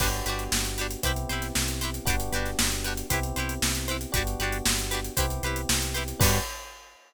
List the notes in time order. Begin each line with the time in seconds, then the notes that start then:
0.00 G1 B3 D4 F#4 G4 B4, kick, crash
0.13 closed hi-hat
0.26 G1 D4 F#4 G4 B4, closed hi-hat
0.39 closed hi-hat
0.52 G1, snare
0.65 closed hi-hat
0.78 D4 F#4 G4 B4, closed hi-hat
0.91 closed hi-hat
1.03 C2 B3 C4 E4 G4 B4 C5, kick, closed hi-hat
1.16 closed hi-hat
1.29 C2 E4 G4 B4 C5, closed hi-hat
1.42 snare, closed hi-hat
1.55 C2, snare
1.68 closed hi-hat
1.81 E4 G4 B4 C5, closed hi-hat
1.94 closed hi-hat
2.05 G1 B3 D4 F#4 G4 B4, kick, closed hi-hat
2.10 D4
2.20 closed hi-hat
2.32 G1 D4 F#4 G4 B4, closed hi-hat
2.45 snare, closed hi-hat
2.59 G1, snare
2.72 closed hi-hat
2.84 D4 F#4 G4 B4, closed hi-hat
2.97 closed hi-hat
3.10 C2 B3 C4 E4 G4 B4 C5, kick, closed hi-hat
3.23 closed hi-hat
3.36 C2 E4 G4 B4 C5, closed hi-hat
3.49 closed hi-hat
3.62 C2, snare
3.75 snare, closed hi-hat
3.88 E4 G4 B4 C5, closed hi-hat
4.01 closed hi-hat
4.12 G1 B3 D4 F#4 G4 B4, kick, closed hi-hat
4.17 D4
4.27 closed hi-hat
4.39 G1 D4 F#4 G4 B4, closed hi-hat
4.52 closed hi-hat
4.66 G1, snare
4.78 closed hi-hat
4.91 D4 F#4 G4 B4, snare, closed hi-hat
5.04 closed hi-hat
5.17 C2 B3 C4 E4 G4 B4 C5, kick, closed hi-hat
5.30 closed hi-hat
5.43 C2 E4 G4 B4 C5, closed hi-hat
5.56 closed hi-hat
5.69 C2, snare
5.82 closed hi-hat
5.94 E4 G4 B4 C5, closed hi-hat
6.08 closed hi-hat
6.20 G2 B3 D4 F#4 G4 B4, kick, crash
6.24 D4